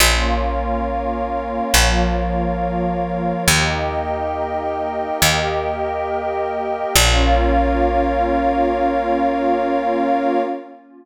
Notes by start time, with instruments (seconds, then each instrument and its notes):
0.00 electric bass (finger) A#1, pad 5 (bowed) A#3 C#4 F4 A#4 C#5 F5
1.74 electric bass (finger) A#1, pad 5 (bowed) F3 A#3 F4
3.48 electric bass (finger) D#2, pad 5 (bowed) A#3 D#4 G4 A#4 D#5 G5
5.22 electric bass (finger) D#2, pad 5 (bowed) A#3 G4 A#4
6.94 electric bass (finger) A#1, pad 5 (bowed) A#3 C#4 F4 A#4 C#5 F5